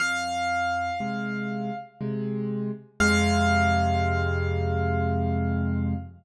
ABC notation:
X:1
M:3/4
L:1/8
Q:1/4=60
K:Fm
V:1 name="Acoustic Grand Piano"
f4 z2 | f6 |]
V:2 name="Acoustic Grand Piano" clef=bass
F,,2 [C,A,]2 [C,A,]2 | [F,,C,A,]6 |]